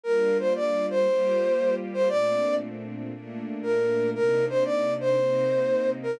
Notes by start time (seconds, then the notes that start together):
0.04 G3 A#3 D4 F4 A#4
0.40 C5
0.56 D5
0.90 C5
1.07 G3 A#3 F4 G4
1.94 C5
2.09 A#2 A3 C4 D4 D5
3.13 A#2 A3 A#3 D4
3.63 A#4
4.15 C3 A#3 D4 D#4 A#4
4.49 C5
4.65 D5
5.00 C5
5.17 C3 A#3 C4 D#4
6.03 A#4